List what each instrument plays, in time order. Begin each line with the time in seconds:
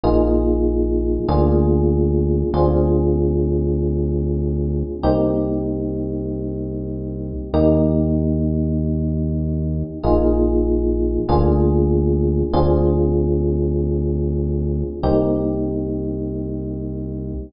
0.04 synth bass 1 A#1, electric piano 1 A#3 D#4 F4 G#4
1.28 synth bass 1 D2, electric piano 1 A#3 D4 F4 G#4
2.54 synth bass 1 D2, electric piano 1 C4 D4 F4 G#4
5.03 synth bass 1 C2, electric piano 1 A#3 C4 D#4 G4
7.54 synth bass 1 D#2, electric piano 1 A#3 D#4 G4
10.03 synth bass 1 A#1, electric piano 1 A#3 D#4 F4 G#4
11.29 synth bass 1 D2, electric piano 1 A#3 D4 F4 G#4
12.53 synth bass 1 D2, electric piano 1 C4 D4 F4 G#4
15.03 synth bass 1 C2, electric piano 1 A#3 C4 D#4 G4